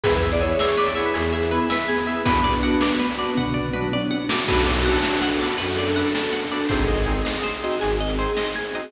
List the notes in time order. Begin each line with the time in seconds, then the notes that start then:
0.03 E2 B3 E4 G#4 B4, kick, closed hi-hat
0.15 B4
0.23 E5
0.31 D5, closed hi-hat
0.41 B3 E4 G#4 C#5 G#5
0.50 C#5
0.59 D5 E5, snare
0.68 C#5
0.77 B4 D5
0.86 D5, closed hi-hat
0.95 B3 E4 G#4 C#5 E5
1.05 B4
1.14 E2 G#4 G#5, closed hi-hat
1.33 G#4 E5
1.43 closed hi-hat
1.51 B3 E4 G#4 B4
1.70 B4 E5, snare
1.88 B3 G#4 G#5
1.98 closed hi-hat
2.07 B3 E4 G#4 E5
2.26 B3 D4 F#4 B4, kick, closed hi-hat
2.44 D5
2.54 closed hi-hat
2.63 B3 D4 F#4 F#5
2.81 D5, snare
3.00 B4
3.10 closed hi-hat
3.18 B3 D4 F#4 D5
3.35 B3 F#5, kick, floor tom
3.54 D5, floor tom
3.73 B3 D4 F#4 B4, mid tom
3.92 D5, high tom
4.11 F#5, high tom
4.29 B3 D4 F#4 D5, snare
4.47 B1 B3 D4 F#4 A4 B4, kick, crash
4.66 D5
4.75 closed hi-hat
4.85 B3 D4 F#4 A4 F#5
5.03 A5, snare
5.22 F#4 F#5
5.32 closed hi-hat
5.41 B3 D4 F#4 A4 D5
5.58 F#2 A4 B4, closed hi-hat
5.79 D5
5.87 closed hi-hat
5.96 B3 D4 F#4 A4 F#5
6.15 A5, snare
6.33 F#5
6.43 closed hi-hat
6.52 B3 D4 F#4 A4 D5
6.69 G#1 C4 D#4 G#4 C5, kick, closed hi-hat
6.88 D#5
6.97 closed hi-hat
7.06 C4 D#4 G#4 G#5
7.25 D#5, snare
7.44 C5
7.53 closed hi-hat
7.63 C4 D#4 F#4 G#4 D#5
7.80 G#1 G#4 G#5, closed hi-hat
8.01 D#5
8.09 closed hi-hat
8.18 C4 D#4 G#4 C5
8.37 D#5, snare
8.56 G#5
8.65 closed hi-hat
8.74 C4 D#4 F#4 G#4 D#5